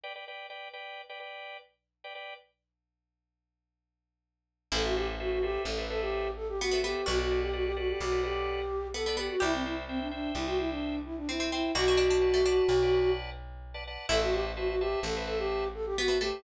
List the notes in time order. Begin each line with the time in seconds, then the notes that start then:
0.03 B4 D5 G5
0.15 B4 D5 G5
0.28 B4 D5 G5
0.50 B4 D5 G5
0.73 B4 D5 G5
1.09 B4 D5 G5
1.20 B4 D5 G5
2.04 B4 D5 G5
2.15 B4 D5 G5
4.72 A1 E4 A4 B4 C5 E5
4.84 F#4 A4 B4 C5 E5
4.96 G4 A4 B4 C5 E5
5.19 F#4 A4 B4 C5 E5
5.31 F#4
5.42 G4 A4 B4 C5 E5
5.65 A1 A4
5.77 A4 B4 C5 E5
5.90 A4 B4 C5 E5
6.01 G4
6.36 A4
6.48 G4
6.60 B3 F#4
6.71 B3 A4 B4 C5 E5
6.83 B3 G4 A4 B4 C5 E5
7.06 B1 F#4 A4 B4 D5 F#5
7.18 F#4 A4 B4 D5 F#5
7.31 A4 B4 D5 F#5
7.42 G4
7.53 F#4 A4 B4 D5 F#5
7.65 G4
7.76 F#4 A4 B4 D5 F#5
7.88 G4
8.00 B1 F#4
8.12 A4 B4 D5 F#5
8.23 G4 A4 B4 D5 F#5
8.94 B3 A4
9.06 B3 A4 B4 D5 F#5
9.17 B3 G4 A4 B4 D5 F#5
9.29 F#4
9.40 C2 E4 G4 C5 E5 G5
9.53 C4 C5 E5 G5
9.64 E4 C5 E5 G5
9.88 C4 C5 E5 G5
10.00 D4
10.11 D4 C5 E5 G5
10.35 C2 E4
10.46 F#4 C5 E5 G5
10.58 E4 C5 E5 G5
10.70 D4
11.05 E4
11.17 D4
11.28 C4 E4
11.39 C4 C5 E5 G5
11.52 C4 E4 C5 E5 G5
11.75 B1 F#4 B4 D5 F#5 A5
11.88 F#4 B4 D5 F#5 A5
11.97 D4 B4 D5 F#5 A5
12.10 D4
12.21 B4 D5 F#5 A5
12.34 A3
12.45 D4 B4 D5 F#5 A5
12.68 B1
12.82 B4 D5 F#5 A5
12.93 B4 D5 F#5 A5
13.74 B4 D5 F#5 A5
13.87 B4 D5 F#5 A5
14.09 A1 E4 A4 B4 C5 E5 A5
14.21 F#4 B4 C5 E5 A5
14.33 G4 B4 C5 E5 A5
14.56 F#4 B4 C5 E5 A5
14.68 F#4
14.80 G4 B4 C5 E5 A5
15.03 A1 A4
15.15 B4 C5 E5 A5
15.27 A4 B4 C5 E5 A5
15.39 G4
15.74 A4
15.86 G4
15.97 B3 F#4
16.08 B3 B4 C5 E5 A5
16.21 A3 G4 B4 C5 E5 A5